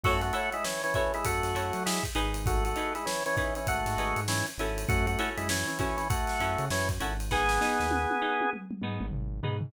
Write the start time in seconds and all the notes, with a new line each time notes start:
0.03 F#2 A3 E4 F#4 A4 C#5, kick, crash
0.21 A3 F#4, ride
0.33 E4 F#4 A4 C#5, ride
0.52 G#3 E4, ride
0.64 E3 C#4, snare
0.83 E3 C#4, ride
0.94 E3 C#4 E4 F#4 A4 C#5, kick, ride
1.14 G#3 E4, ride
1.24 F#2 A3 F#4, kick, ride
1.43 F#2, snare, ride
1.55 F#2 E4 F#4 A4 C#5, ride
1.73 F#3, ride
1.86 G#3 E4, snare
2.03 kick, ride
2.15 G#1 D#4 G#4 B4, ride
2.34 ride
2.46 A3 F#4, kick, ride
2.65 A3 F#4, ride
2.76 D#4 G#4 B4, ride
2.95 G#3 E4, ride
3.06 E3 C#4, snare
3.26 E3 C#4, ride
3.37 E3 C#4 D#4 G#4 B4, kick, snare, ride
3.55 E3 C#4, ride
3.67 G#1 A3 F#4, kick, ride
3.86 G#2, snare, ride
3.97 G#1 D#4 G#4 B4, snare, ride
4.16 G#2, ride
4.28 E3 C#4, snare
4.46 ride
4.57 G#1 C#4 E4 F#4 A4, snare, ride
4.78 ride
4.88 F#2 A3 F#4, kick, ride
5.07 A3 F#4, ride
5.19 C#4 E4 F#4 A4, ride
5.37 F#2 G#3 E4, ride
5.49 E3 C#4, snare
5.67 E3 C#4, snare, ride
5.79 E3 C#4 E4 F#4 A4, kick, snare, ride
5.97 E3 C#4, snare, ride
6.10 A3 F#4, kick, ride
6.27 snare, ride
6.40 F#2 C#4 E4 F#4 A4, ride
6.58 C#3, ride
6.70 F#2 E3 C#4, snare
6.89 kick, ride
7.00 G#1 C#4 E4 F#4 A4, ride
7.20 snare, ride
7.31 B3 D#4 G#4, kick, snare
7.49 snare
7.61 B3 D#4 G#4, snare
7.80 D#2, snare
7.91 high tom
8.10 high tom
8.21 B3 D#4 G#4
8.41 high tom
8.53 mid tom
8.71 mid tom
8.82 G#2 B3 D#4 G#4, mid tom
9.01 G#1, mid tom
9.12 G#1, floor tom
9.43 G#2 B3 D#4 G#4, floor tom
9.61 floor tom